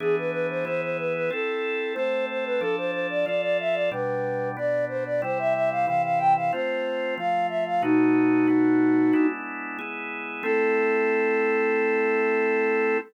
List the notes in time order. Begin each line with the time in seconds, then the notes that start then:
0.00 E3 B3 D4 G#4
0.18 B4
0.31 B4
0.50 C5
0.65 E3 B3 E4 G#4 C5
0.82 C5
0.98 B4
1.15 B4
1.30 C4 E4 A4
1.94 A3 C4 A4 C5
2.29 C5
2.45 B4
2.60 F3 D4 A4
2.77 C5
2.92 C5
3.10 D5
3.26 F3 F4 A4 D5
3.42 D5
3.60 E5
3.74 D5
3.91 B2 G3 D4 B4
4.57 B2 B3 D4 D5
4.89 C5
5.06 D5
5.22 C3 G3 E4 C5
5.39 E5
5.54 E5
5.71 F5
5.87 C3 E3 E4 F5
6.04 F5
6.18 G5
6.36 F5
6.52 A3 C4 F4 C5
7.18 F3 A3 F4 F5
7.49 E5
7.66 F5
7.82 B2 A3 D#4 F#4
8.48 B2 A3 B3 F#4
9.13 G#3 B3 D4 E4
9.79 G#3 B3 E4 G#4
10.43 A3 C4 E4 A4